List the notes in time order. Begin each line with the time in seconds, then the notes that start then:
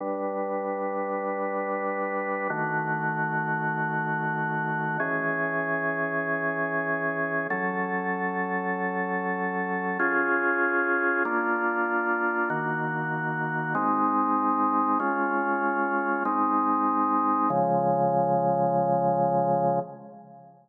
0.00 G3 D4 B4
2.50 D#3 A3 F#4
5.00 E3 C#4 G#4
7.50 F#3 C#4 A4
9.99 C#4 F4 G#4
11.25 A#3 D4 F4
12.50 D#3 A#3 F#4
13.75 G#3 C4 D#4
15.00 G#3 C#4 F4
16.25 G#3 C4 D#4
17.50 C#3 F3 G#3